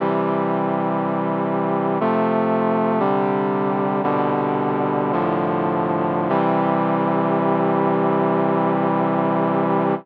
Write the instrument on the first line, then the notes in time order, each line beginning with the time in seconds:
brass section
0.00 C3 E3 G3
2.00 C3 F3 A3
3.00 C3 D3 G3
4.03 C2 B2 D3 G3
5.12 C2 A2 D3 F3
6.29 C3 E3 G3